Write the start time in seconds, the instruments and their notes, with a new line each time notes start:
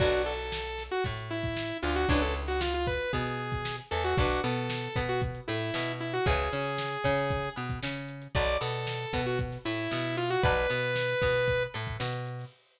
0.00 electric bass (finger) B1, acoustic guitar (steel) D4 F#4 A4 B4, lead 2 (sawtooth) F#4, kick, crash
0.13 closed hi-hat
0.26 lead 2 (sawtooth) A4, closed hi-hat
0.39 closed hi-hat
0.52 snare
0.65 closed hi-hat
0.78 snare, closed hi-hat
0.91 lead 2 (sawtooth) F#4, closed hi-hat
1.04 electric bass (finger) A2, acoustic guitar (steel) A3, kick, closed hi-hat
1.17 closed hi-hat
1.30 lead 2 (sawtooth) E4, closed hi-hat
1.43 kick, closed hi-hat
1.57 snare
1.70 closed hi-hat
1.82 electric bass (finger) D2, acoustic guitar (steel) D4, lead 2 (sawtooth) F4, closed hi-hat
1.96 lead 2 (sawtooth) F#4, closed hi-hat
2.09 electric bass (finger) C#2, acoustic guitar (steel) C#4 E4 G#4 B4, lead 2 (sawtooth) D4, kick, closed hi-hat
2.22 lead 2 (sawtooth) A4, closed hi-hat
2.35 closed hi-hat
2.48 lead 2 (sawtooth) F#4, snare, closed hi-hat
2.61 lead 2 (sawtooth) F4, snare
2.74 lead 2 (sawtooth) F4, snare, closed hi-hat
2.87 lead 2 (sawtooth) B4, kick, snare, closed hi-hat
3.00 closed hi-hat
3.13 electric bass (finger) B2, acoustic guitar (steel) B3, lead 2 (sawtooth) G#4, kick, closed hi-hat
3.26 closed hi-hat
3.39 closed hi-hat
3.52 kick, closed hi-hat
3.65 snare
3.78 closed hi-hat
3.91 electric bass (finger) E2, acoustic guitar (steel) E3, lead 2 (sawtooth) A4, closed hi-hat
4.04 lead 2 (sawtooth) F#4, snare, closed hi-hat
4.17 electric bass (finger) B1, acoustic guitar (steel) D4 F#4 A4 B4, lead 2 (sawtooth) F#4, kick, closed hi-hat
4.30 snare, closed hi-hat
4.43 electric bass (finger) B2, acoustic guitar (steel) B3, lead 2 (sawtooth) A4, closed hi-hat
4.57 closed hi-hat
4.70 snare
4.83 closed hi-hat
4.96 electric bass (finger) B2, acoustic guitar (steel) B3, kick, snare, closed hi-hat
5.09 lead 2 (sawtooth) F#4, closed hi-hat
5.22 kick, closed hi-hat
5.35 closed hi-hat
5.48 electric bass (finger) A2, acoustic guitar (steel) A3, lead 2 (sawtooth) E4, closed hi-hat
5.61 closed hi-hat
5.74 electric bass (finger) B2, acoustic guitar (steel) B3, snare
5.87 snare, closed hi-hat
6.00 lead 2 (sawtooth) E4, closed hi-hat
6.13 lead 2 (sawtooth) F#4, closed hi-hat
6.26 electric bass (finger) C#2, acoustic guitar (steel) C#4 E4 G#4 B4, lead 2 (sawtooth) G#4, kick, closed hi-hat
6.39 closed hi-hat
6.52 electric bass (finger) C#3, acoustic guitar (steel) C#4, closed hi-hat
6.65 closed hi-hat
6.78 snare
6.91 closed hi-hat
7.04 electric bass (finger) C#3, acoustic guitar (steel) C#4, kick, snare, closed hi-hat
7.17 snare, closed hi-hat
7.30 kick, closed hi-hat
7.43 closed hi-hat
7.56 electric bass (finger) B2, acoustic guitar (steel) B3, closed hi-hat
7.70 kick, closed hi-hat
7.83 electric bass (finger) C#3, acoustic guitar (steel) C#4, snare
7.96 closed hi-hat
8.09 closed hi-hat
8.22 closed hi-hat
8.35 electric bass (finger) B1, acoustic guitar (steel) D5 F#5 A5 B5, lead 2 (sawtooth) D5, kick, closed hi-hat
8.48 closed hi-hat
8.61 electric bass (finger) B2, acoustic guitar (steel) B3, lead 2 (sawtooth) A4, snare, closed hi-hat
8.74 closed hi-hat
8.87 snare
9.00 closed hi-hat
9.13 electric bass (finger) B2, acoustic guitar (steel) B3, kick, snare, closed hi-hat
9.26 lead 2 (sawtooth) F#4, closed hi-hat
9.39 kick, closed hi-hat
9.52 snare, closed hi-hat
9.65 electric bass (finger) A2, acoustic guitar (steel) A3, lead 2 (sawtooth) E4, snare, closed hi-hat
9.78 closed hi-hat
9.91 electric bass (finger) B2, acoustic guitar (steel) B3, snare
10.04 closed hi-hat
10.17 lead 2 (sawtooth) F4, closed hi-hat
10.30 lead 2 (sawtooth) F#4, closed hi-hat
10.43 electric bass (finger) B1, lead 2 (sawtooth) B4, acoustic guitar (steel) D5 F#5 A5 B5, kick, closed hi-hat
10.57 closed hi-hat
10.70 electric bass (finger) B2, acoustic guitar (steel) B3, closed hi-hat
10.83 closed hi-hat
10.96 snare
11.09 snare, closed hi-hat
11.22 electric bass (finger) B2, acoustic guitar (steel) B3, kick, snare, closed hi-hat
11.35 closed hi-hat
11.48 kick, closed hi-hat
11.61 closed hi-hat
11.74 electric bass (finger) A2, acoustic guitar (steel) A3, closed hi-hat
11.87 kick, closed hi-hat
12.00 electric bass (finger) B2, acoustic guitar (steel) B3, snare
12.13 snare, closed hi-hat
12.26 closed hi-hat
12.39 open hi-hat